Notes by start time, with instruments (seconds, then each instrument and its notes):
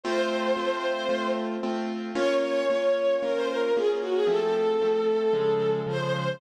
0.04 acoustic grand piano A3 C4 F4, violin C5
0.57 acoustic grand piano A3 C4 F4
1.09 acoustic grand piano A3 C4 F4
1.63 acoustic grand piano A3 C4 F4
2.15 acoustic grand piano A#3 C#4 F4, violin C#5
2.43 violin C#5
2.70 acoustic grand piano A#3 C#4 F4
3.22 acoustic grand piano A#3 C#4 F4, violin A#4
3.35 violin C5
3.49 violin A#4
3.75 acoustic grand piano A#3 C#4 F4, violin G#4
4.02 violin F#4
4.15 violin G#4
4.27 acoustic grand piano F3 A3 C4, violin A4
4.81 acoustic grand piano F3 A3 C4
5.33 acoustic grand piano C#3 F3 G#3
5.87 acoustic grand piano C#3 F3 G#3, violin C5